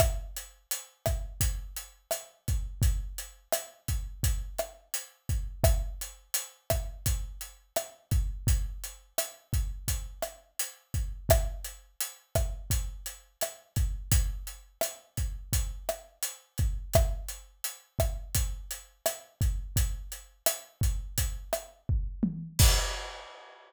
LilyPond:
\new DrumStaff \drummode { \time 4/4 \tempo 4 = 85 <hh bd ss>8 hh8 hh8 <hh bd ss>8 <hh bd>8 hh8 <hh ss>8 <hh bd>8 | <hh bd>8 hh8 <hh ss>8 <hh bd>8 <hh bd>8 <hh ss>8 hh8 <hh bd>8 | <hh bd ss>8 hh8 hh8 <hh bd ss>8 <hh bd>8 hh8 <hh ss>8 <hh bd>8 | <hh bd>8 hh8 <hh ss>8 <hh bd>8 <hh bd>8 <hh ss>8 hh8 <hh bd>8 |
<hh bd ss>8 hh8 hh8 <hh bd ss>8 <hh bd>8 hh8 <hh ss>8 <hh bd>8 | <hh bd>8 hh8 <hh ss>8 <hh bd>8 <hh bd>8 <hh ss>8 hh8 <hh bd>8 | <hh bd ss>8 hh8 hh8 <hh bd ss>8 <hh bd>8 hh8 <hh ss>8 <hh bd>8 | <hh bd>8 hh8 <hh ss>8 <hh bd>8 <hh bd>8 <hh ss>8 bd8 tommh8 |
<cymc bd>4 r4 r4 r4 | }